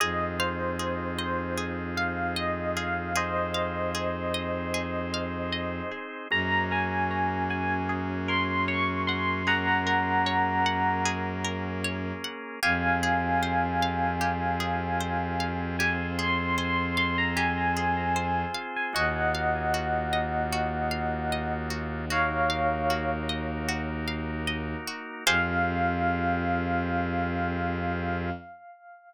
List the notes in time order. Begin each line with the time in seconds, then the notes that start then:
0.00 F2 C4 D#4 F4 G#4 D#5
0.39 C5 F5
0.79 G#4
1.18 C5 D#5
1.58 G#4
1.97 F5
2.36 D#5
2.77 G#4 F5
3.15 C4 D#4 G#4 C5 D#5
3.54 F5
3.95 G#4
4.34 D#5
4.74 G#4
5.14 F5
5.52 D#5
5.91 G#4
6.30 F#2 A#3 C#4 F#4 G#4 A#5
6.71 A#4 G#5
7.11 C#5
7.50 F#5 G#5
7.89 G#4
8.28 A#4 C6
8.68 C#5 C#6
9.07 F#5 C6
9.47 A#3 C#4 G#4 A#4 F#5 A#5
9.87 A#4
10.26 C#5
10.66 F#5
11.05 G#4
11.45 A#4
11.84 C#5
12.24 F#5
12.63 F2 C4 F4 G4 G#4 F5 G#5
13.03 G#4
13.43 C5
13.82 F5
14.21 G4
14.60 G#4
15.00 C5
15.40 F5
15.79 C4 F4 G4 G#4 C5 G#5
16.18 G#4 C6
16.58 C5 C6
16.97 F5 C6
17.18 A#5
17.36 G4 G#5
17.77 G#4
18.16 C5
18.54 F5
18.76 G#5
18.93 D#2 A#3 D#4 F4 F#4 D#5 F#5
19.35 F5
19.74 F#4
20.13 D#5
20.52 F#4
20.91 F5
21.32 D#5
21.70 F#4
22.10 A#3 D#4 F#4 A#4 C#5 F5
22.50 F5
22.90 F#4
23.29 D#5
23.69 F#4
24.08 F5
24.47 D#5
24.88 F#4
25.26 F2 C4 F4 G4 G#4 C5 F5